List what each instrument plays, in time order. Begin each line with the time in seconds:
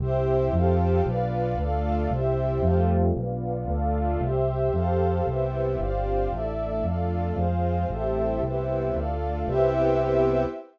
0.00 synth bass 1 C2, string ensemble 1 C4 E4 G4, pad 2 (warm) G4 C5 E5
0.53 synth bass 1 F2, string ensemble 1 C4 F4 G4 A4, pad 2 (warm) G4 A4 C5 F5
1.05 synth bass 1 B1, string ensemble 1 B3 D4 F4, pad 2 (warm) B4 D5 F5
1.58 synth bass 1 D2, string ensemble 1 A3 D4 F4, pad 2 (warm) A4 D5 F5
2.11 synth bass 1 C2, string ensemble 1 G3 C4 E4, pad 2 (warm) G4 C5 E5
2.63 synth bass 1 F2, string ensemble 1 G3 A3 C4 F4, pad 2 (warm) G4 A4 C5 F5
3.14 synth bass 1 B1, string ensemble 1 B3 D4 F4, pad 2 (warm) B4 D5 F5
3.68 synth bass 1 D2, string ensemble 1 A3 D4 F4, pad 2 (warm) A4 D5 F5
4.21 synth bass 1 C2, pad 2 (warm) G4 C5 E5
4.73 synth bass 1 F2, pad 2 (warm) G4 A4 C5 F5
5.26 synth bass 1 C2, string ensemble 1 G3 B3 C4 E4, pad 2 (warm) G4 B4 C5 E5
5.79 synth bass 1 G1, string ensemble 1 G3 C4 D4 F4, pad 2 (warm) G4 C5 D5 F5
6.31 synth bass 1 A1, string ensemble 1 A3 D4 E4, pad 2 (warm) A4 D5 E5
6.83 synth bass 1 F2, string ensemble 1 A3 D4 F4, pad 2 (warm) A4 D5 F5
7.35 synth bass 1 F2, string ensemble 1 G#3 C4 F4, pad 2 (warm) G#4 C5 F5
7.90 synth bass 1 A1, string ensemble 1 G3 A3 C4 E4, pad 2 (warm) G4 A4 C5 E5
8.42 synth bass 1 C2, string ensemble 1 G3 B3 C4 E4, pad 2 (warm) G4 B4 C5 E5
8.94 synth bass 1 D2, string ensemble 1 A3 D4 F4, pad 2 (warm) A4 D5 F5
9.46 synth bass 1 C2, string ensemble 1 B3 C4 E4 G4, pad 2 (warm) G4 B4 C5 E5